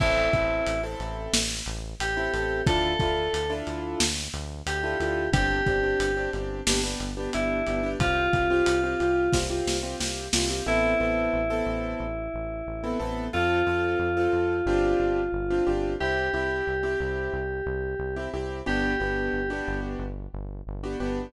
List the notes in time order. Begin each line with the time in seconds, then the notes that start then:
0.00 A1 C4 E4 A4, kick, crash
0.33 A1 C4 E4 A4, kick, closed hi-hat
0.67 A1, closed hi-hat
0.83 C4 E4 A4
0.99 A1, closed hi-hat
1.33 A1, snare
1.66 A1, closed hi-hat
2.00 A1 G4, closed hi-hat
2.17 C4 E4 A4
2.33 A1 C4 E4 A4, closed hi-hat
2.67 D2 D4 E4 F4 A4, kick, closed hi-hat
2.99 D2 D4 E4 F4 A4, kick, closed hi-hat
3.33 D2, closed hi-hat
3.50 D4 E4 F4 A4
3.67 D2, closed hi-hat
4.00 D2, snare
4.34 D2, closed hi-hat
4.66 D2 G4, closed hi-hat
4.83 D4 E4 F4 A4
5.00 D2 D4 E4 F4 A4, closed hi-hat
5.32 G1 C4 D4 G4, kick, closed hi-hat
5.66 G1 C4 D4 G4, kick, closed hi-hat
5.83 C4 D4 G4
6.00 G1, closed hi-hat
6.17 C4 D4 G4
6.33 G1 C4 D4 G4, closed hi-hat
6.67 G1 B3 D4 G4, snare
6.83 B3 D4 G4
6.99 G1, closed hi-hat
7.17 B3 D4 G4
7.33 G1 B3 D4 E4 G4, closed hi-hat
7.67 G1 B3 D4 G4, closed hi-hat
7.83 B3 D4 G4
7.99 C2 C4 F4 G4, kick, closed hi-hat
8.33 C2 C4 F4 G4, kick, closed hi-hat
8.50 C4 F4 G4
8.66 C2, closed hi-hat
8.83 C4 F4 G4
9.00 C2 C4 F4 G4, closed hi-hat
9.33 C2 C4 F4 G4, kick, snare
9.50 C4 F4 G4
9.67 C2, snare
9.83 C4 F4 G4
10.00 C2 C4 F4 G4, snare
10.33 C2 C4 F4 G4, snare
10.50 C4 F4 G4
10.66 A1 B3 C4 E4 A4
11.00 A1 B3 C4 E4 A4
11.33 A1
11.50 B3 C4 E4 A4
11.66 A1
12.00 A1
12.34 A1
12.67 A1
12.83 B3 C4 E4 A4
13.00 A1 B3 C4 E4 A4
13.33 F2 C4 F4 A4
13.67 F2 C4 F4 A4
13.99 F2
14.17 C4 F4 A4
14.33 F2
14.66 G1 C4 D4 F4 G4
15.00 G1
15.32 G1
15.50 C4 D4 F4 G4
15.67 G1 C4 D4 F4 G4
16.00 C2 C4 E4 G4
16.33 C2 C4 E4 G4
16.67 C2
16.83 C4 E4 G4
17.00 C2
17.33 C2
17.66 C2
17.99 C2
18.16 C4 E4 G4
18.33 C2 C4 E4 G4
18.66 G1 B3 D4 F#4 G4
19.00 G1 B3 D4 F#4 G4
19.33 G1
19.50 B3 D4 F#4 G4
19.68 G1
19.99 G1
20.33 G1
20.67 G1
20.83 B3 D4 F#4 G4
21.00 G1 B3 D4 F#4 G4